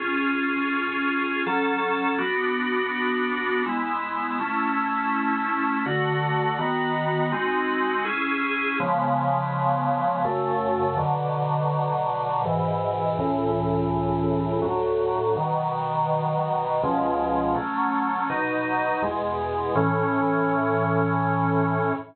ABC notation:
X:1
M:3/4
L:1/8
Q:1/4=82
K:F#m
V:1 name="Drawbar Organ"
[C^EG]4 [F,CA]2 | [B,DF]4 [G,B,E]2 | [A,CE]4 [D,A,F]2 | [^D,B,F]2 [G,^B,^DF]2 [CEG]2 |
[C,^E,G,B,]4 [F,,C,A,]2 | [B,,D,F,]4 [G,,B,,E,]2 | [C,,A,,E,]4 [D,,A,,F,]2 | [B,,^D,F,]4 [C,,B,,^E,G,]2 |
[K:A] [F,A,C]2 [B,,F,^D]2 [E,,B,,G,]2 | [A,,E,C]6 |]